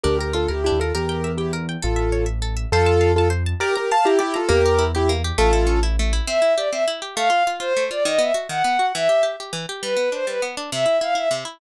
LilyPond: <<
  \new Staff \with { instrumentName = "Acoustic Grand Piano" } { \time 6/8 \key d \minor \tempo 4. = 135 <g' bes'>8 <g' bes'>8 <f' a'>8 <e' g'>8 <e' g'>8 <f' a'>8 | <g' bes'>4. <e' g'>8 r4 | <f' a'>4. r4. | <f' a'>4. <f' a'>8 r4 |
<g' bes'>8 <g' bes'>8 <f'' a''>8 <e' g'>8 <e' g'>8 <f' a'>8 | <g' bes'>4. <e' g'>8 r4 | <f' a'>4. r4. | \key a \minor r2. |
r2. | r2. | r2. | r2. |
r2. | }
  \new Staff \with { instrumentName = "Violin" } { \time 6/8 \key d \minor r2. | r2. | r2. | r2. |
r2. | r2. | r2. | \key a \minor e''4 d''8 e''8 r4 |
f''4 r8 c''4 d''8 | dis''8 e''8 r8 fis''4. | e''4 r2 | b'4 c''8 b'8 r4 |
e''4 f''8 e''8 r4 | }
  \new Staff \with { instrumentName = "Orchestral Harp" } { \time 6/8 \key d \minor d'8 bes'8 f'8 bes'8 d'8 bes'8 | bes'8 g''8 e''8 g''8 bes'8 g''8 | a'8 e''8 cis''8 e''8 a'8 e''8 | c''8 a''8 f''8 a''8 c''8 a''8 |
d''8 bes''8 f''8 bes''8 d''8 bes''8 | bes8 g'8 e'8 g'8 bes8 g'8 | a8 e'8 cis'8 e'8 a8 e'8 | \key a \minor c'8 e'8 g'8 c'8 e'8 g'8 |
a8 f'8 f'8 f'8 a8 f'8 | dis8 b8 fis'8 dis8 b8 fis'8 | e8 g'8 g'8 g'8 e8 g'8 | g8 b8 d'8 g8 b8 d'8 |
c8 e'8 e'8 e'8 c8 e'8 | }
  \new Staff \with { instrumentName = "Acoustic Grand Piano" } { \clef bass \time 6/8 \key d \minor d,4. d,8. ees,8. | e,2. | a,,2. | f,2. |
r2. | e,2. | a,,2. | \key a \minor r2. |
r2. | r2. | r2. | r2. |
r2. | }
>>